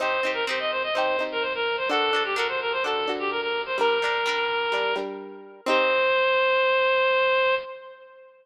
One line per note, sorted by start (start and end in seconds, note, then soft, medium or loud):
0.00 0.21 C4 medium
0.00 0.21 D#4 medium
0.00 0.21 G4 medium
0.00 0.31 C5 medium
0.23 0.45 C4 medium
0.23 0.45 D#4 medium
0.23 0.45 G4 medium
0.34 0.45 A#4 medium
0.47 0.91 C4 medium
0.47 0.91 D#4 medium
0.47 0.91 G4 medium
0.47 0.59 C5 medium
0.59 0.71 D#5 medium
0.71 0.82 C5 medium
0.83 0.94 D#5 medium
0.94 1.17 C4 medium
0.94 1.17 D#4 medium
0.94 1.24 C5 medium
0.98 1.17 G4 medium
1.19 1.84 C4 medium
1.19 1.84 D#4 medium
1.19 1.84 G4 medium
1.32 1.43 A#4 medium
1.42 1.53 C5 medium
1.55 1.76 A#4 medium
1.77 1.89 C5 medium
1.89 2.11 D4 medium
1.89 2.11 F#4 medium
1.89 2.23 A4 medium
1.89 2.11 A4 medium
2.13 2.35 D4 medium
2.13 2.35 F#4 medium
2.13 2.35 A4 medium
2.24 2.36 G4 medium
2.36 2.80 D4 medium
2.36 2.80 F#4 medium
2.36 2.80 A4 medium
2.36 2.47 A#4 medium
2.48 2.60 C5 medium
2.61 2.72 A#4 medium
2.72 2.83 C5 medium
2.84 3.06 D4 medium
2.84 3.06 F#4 medium
2.84 3.12 A4 medium
2.84 3.06 A4 medium
3.08 3.73 D4 medium
3.08 3.73 F#4 medium
3.08 3.73 A4 medium
3.19 3.30 G4 medium
3.31 3.41 A#4 medium
3.41 3.62 A#4 medium
3.66 3.77 C5 medium
3.78 3.99 G3 medium
3.78 3.99 D4 medium
3.78 4.95 A#4 medium
3.78 3.99 A#4 medium
4.02 4.24 G3 medium
4.02 4.24 D4 medium
4.02 4.24 A#4 medium
4.26 4.69 G3 medium
4.26 4.69 D4 medium
4.26 4.69 A#4 medium
4.72 4.94 G3 medium
4.72 4.94 D4 medium
4.72 4.94 A#4 medium
4.96 5.61 G3 medium
4.96 5.61 D4 medium
4.96 5.61 A#4 medium
5.66 7.54 C4 loud
5.66 7.54 D#4 loud
5.66 7.54 G4 medium
5.66 7.55 C5 loud